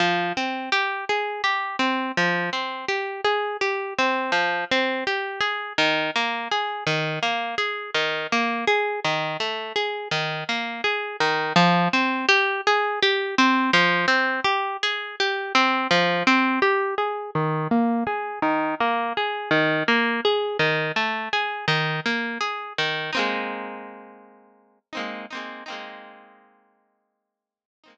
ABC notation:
X:1
M:4/4
L:1/8
Q:1/4=83
K:Fm
V:1 name="Acoustic Guitar (steel)"
F, C G A G C F, C | G A G C F, C G A | E, B, A E, B, A E, B, | A E, =A, _A E, B, A E, |
F, C G A G C F, C | G A G C F, C G A | E, B, A E, B, A E, B, | A E, =A, _A E, B, A E, |
[K:Ab] [A,B,CE]5 [A,B,CE] [A,B,CE] [A,B,CE]- | [A,B,CE]5 [A,B,CE] z2 |]